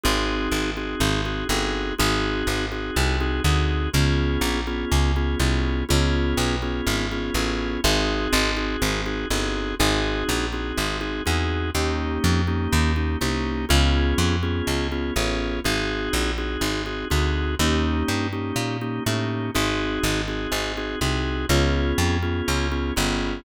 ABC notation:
X:1
M:4/4
L:1/8
Q:1/4=123
K:Ab
V:1 name="Drawbar Organ"
[CE_GA]3 [CEGA]2 [CEGA] [CEGA]2 | [CE_GA]3 [CEGA]2 [CEGA] [CEGA]2 | [_CDFA]3 [CDFA]2 [CDFA] [CDFA]2 | [_CDFA]3 [CDFA]2 [CDFA] [CDFA]2 |
[CE_GA]3 [CEGA]2 [CEGA] [CEGA]2 | [CE_GA]3 [CEGA]2 [CEGA] [CEGA]2 | [B,DEG]3 [B,DEG]2 [B,DEG] [B,DEG]2 | [_CDFA]3 [CDFA]2 [CDFA] [CDFA]2 |
[CE_GA]3 [CEGA]2 [CEGA] [CEGA]2 | [B,DEG]3 [B,DEG]2 [B,DEG] [B,DEG]2 | [CE_GA]3 [CEGA]2 [CEGA] [CEGA]2 | [_CDFA]3 [CDFA]2 [CDFA] [CDFA]2 |]
V:2 name="Electric Bass (finger)" clef=bass
A,,,2 A,,,2 A,,,2 G,,,2 | A,,,2 A,,,2 C,,2 =D,,2 | D,,2 B,,,2 D,,2 C,,2 | D,,2 _C,,2 A,,,2 =A,,,2 |
A,,,2 A,,,2 A,,,2 G,,,2 | A,,,2 B,,,2 A,,,2 =E,,2 | E,,2 F,,2 E,,2 C,,2 | D,,2 F,,2 D,,2 =A,,,2 |
A,,,2 B,,,2 A,,,2 =D,,2 | E,,2 G,,2 B,,2 =A,,2 | A,,,2 A,,,2 A,,,2 C,,2 | D,,2 F,,2 D,,2 G,,,2 |]